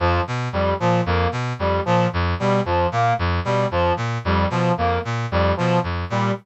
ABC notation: X:1
M:6/8
L:1/8
Q:3/8=75
K:none
V:1 name="Brass Section" clef=bass
F,, B,, F,, ^A,, F,, B,, | F,, ^A,, F,, B,, F,, A,, | F,, B,, F,, ^A,, F,, B,, | F,, ^A,, F,, B,, F,, A,, |]
V:2 name="Brass Section"
F, z G, F, ^A, z | G, F, z G, F, ^A, | z G, F, z G, F, | ^A, z G, F, z G, |]